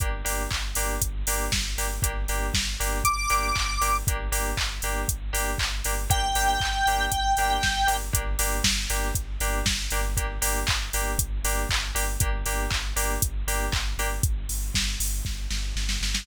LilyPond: <<
  \new Staff \with { instrumentName = "Lead 1 (square)" } { \time 4/4 \key g \phrygian \tempo 4 = 118 r1 | r2 d'''2 | r1 | g''1 |
r1 | r1 | r1 | r1 | }
  \new Staff \with { instrumentName = "Electric Piano 2" } { \time 4/4 \key g \phrygian <bes d' g'>8 <bes d' g'>4 <bes d' g'>4 <bes d' g'>4 <bes d' g'>8 | <bes d' g'>8 <bes d' g'>4 <bes d' g'>4 <bes d' g'>4 <bes d' g'>8 | <bes d' g'>8 <bes d' g'>4 <bes d' g'>4 <bes d' g'>4 <bes d' g'>8 | <bes d' g'>8 <bes d' g'>4 <bes d' g'>4 <bes d' g'>4 <bes d' g'>8 |
<bes d' g'>8 <bes d' g'>4 <bes d' g'>4 <bes d' g'>4 <bes d' g'>8 | <bes d' g'>8 <bes d' g'>4 <bes d' g'>4 <bes d' g'>4 <bes d' g'>8 | <bes d' g'>8 <bes d' g'>4 <bes d' g'>4 <bes d' g'>4 <bes d' g'>8 | r1 | }
  \new Staff \with { instrumentName = "Synth Bass 2" } { \clef bass \time 4/4 \key g \phrygian g,,8 g,,8 g,,8 g,,8 g,,8 g,,8 g,,8 g,,8 | g,,8 g,,8 g,,8 g,,8 g,,8 g,,8 g,,8 g,,8 | g,,8 g,,8 g,,8 g,,8 g,,8 g,,8 g,,8 g,,8 | g,,8 g,,8 g,,8 g,,8 g,,8 g,,8 g,,8 g,,8 |
g,,8 g,,8 g,,8 g,,8 g,,8 g,,8 g,,8 g,,8~ | g,,8 g,,8 g,,8 g,,8 g,,8 g,,8 g,,8 g,,8 | g,,8 g,,8 g,,8 g,,8 g,,8 g,,8 g,,8 g,,8 | g,,8 g,,8 g,,8 g,,8 g,,8 g,,8 g,,8 g,,8 | }
  \new DrumStaff \with { instrumentName = "Drums" } \drummode { \time 4/4 <hh bd>8 hho8 <hc bd>8 hho8 <hh bd>8 hho8 <bd sn>8 hho8 | <hh bd>8 hho8 <bd sn>8 hho8 <hh bd>8 hho8 <hc bd>8 hho8 | <hh bd>8 hho8 <hc bd>8 hho8 <hh bd>8 hho8 <hc bd>8 hho8 | <hh bd>8 hho8 <hc bd>8 hho8 <hh bd>8 hho8 <bd sn>8 hho8 |
<hh bd>8 hho8 <bd sn>8 hho8 <hh bd>8 hho8 <bd sn>8 hho8 | <hh bd>8 hho8 <hc bd>8 hho8 <hh bd>8 hho8 <hc bd>8 hho8 | <hh bd>8 hho8 <hc bd>8 hho8 <hh bd>8 hho8 <hc bd>8 hho8 | <hh bd>8 hho8 <bd sn>8 hho8 <bd sn>8 sn8 sn16 sn16 sn16 sn16 | }
>>